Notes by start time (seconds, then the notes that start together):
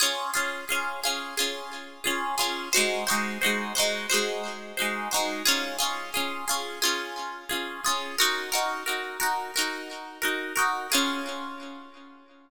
0.00 C#4 F4 G#4
0.34 C#4 F4 G#4
0.69 C#4 F4 G#4
1.04 C#4 F4 G#4
1.37 C#4 F4 G#4
2.04 C#4 F4 G#4
2.38 C#4 F4 G#4
2.73 D#4 F#4 C5
2.77 G#3
3.07 D#4 F#4 C5
3.11 G#3
3.41 D#4 F#4 C5
3.46 G#3
3.75 D#4 F#4 C5
3.79 G#3
4.10 D#4 F#4 C5
4.14 G#3
4.77 D#4 F#4 C5
4.82 G#3
5.11 D#4 F#4 C5
5.16 G#3
5.45 C#4 F4 G#4
5.79 C#4 F4 G#4
6.14 C#4 F4 G#4
6.48 C#4 F4 G#4
6.82 C#4 F4 G#4
7.49 C#4 F4 G#4
7.85 C#4 F4 G#4
8.18 D#4 F#4 A#4
8.52 D#4 F#4 A#4
8.86 D#4 F#4 A#4
9.20 D#4 F#4 A#4
9.56 D#4 F#4 A#4
10.22 D#4 F#4 A#4
10.56 D#4 F#4 A#4
10.92 C#4 F4 G#4